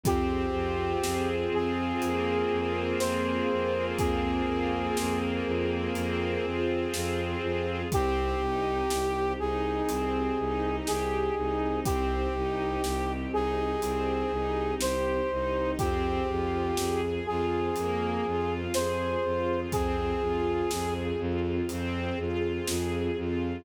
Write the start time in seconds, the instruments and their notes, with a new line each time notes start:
0.03 violin F2, string ensemble 1 C4 F4 G#4, brass section G4, kick, closed hi-hat
0.53 violin F2, string ensemble 1 F4
1.03 violin F2, string ensemble 1 G#4, snare
1.51 violin F2, string ensemble 1 F4, brass section G#4
2.01 violin F2, string ensemble 1 A#3, closed hi-hat
2.51 violin F2, string ensemble 1 F4
2.99 violin F2, string ensemble 1 G#4, brass section C5, snare
3.49 violin F2, string ensemble 1 F4
3.98 violin F2, string ensemble 1 C4, brass section G#4, kick, closed hi-hat
4.46 violin F2, string ensemble 1 F4
4.97 violin F2, string ensemble 1 G#4, snare
5.45 violin F2, string ensemble 1 F4
5.95 violin F2, string ensemble 1 C4, closed hi-hat
6.44 violin F2, string ensemble 1 F4
6.93 violin F2, string ensemble 1 G#4, snare
7.42 violin F2, string ensemble 1 F4
7.92 violin C2, string ensemble 1 C4 D#4 G4, brass section G4, kick, closed hi-hat
8.40 violin C2, string ensemble 1 D#4
8.90 violin C2, string ensemble 1 G4, snare
9.39 violin C2, string ensemble 1 D#4, brass section G#4
9.88 violin C2, string ensemble 1 C4, closed hi-hat
10.38 violin C2, string ensemble 1 D#4
10.86 violin C2, string ensemble 1 G4, brass section G#4, snare
11.35 violin C2, string ensemble 1 D#4
11.84 violin C2, string ensemble 1 C4, brass section G4, kick, closed hi-hat
12.33 violin C2, string ensemble 1 D#4
12.82 violin C2, string ensemble 1 G4, snare
13.31 violin C2, string ensemble 1 D#4, brass section G#4
13.81 violin C2, string ensemble 1 C4, closed hi-hat
14.31 violin C2, string ensemble 1 D#4
14.79 violin C2, string ensemble 1 G4, brass section C5, snare
15.31 violin C2, string ensemble 1 D#4
15.78 violin F2, string ensemble 1 C4 F4 G#4, brass section G4, kick, closed hi-hat
16.27 violin F2, string ensemble 1 F4
16.77 violin F2, string ensemble 1 G#4, snare
17.26 violin F2, string ensemble 1 F4, brass section G#4
17.76 violin F2, string ensemble 1 A#3, closed hi-hat
18.25 violin F2, string ensemble 1 F4
18.74 violin F2, string ensemble 1 G#4, brass section C5, snare
19.23 violin F2, string ensemble 1 F4
19.71 violin F2, string ensemble 1 C4, brass section G#4, kick, closed hi-hat
20.20 violin F2, string ensemble 1 F4
20.71 violin F2, string ensemble 1 G#4, snare
21.19 violin F2, string ensemble 1 F4
21.69 violin F2, string ensemble 1 C4, closed hi-hat
22.18 violin F2, string ensemble 1 F4
22.67 violin F2, string ensemble 1 G#4, snare
23.17 violin F2, string ensemble 1 F4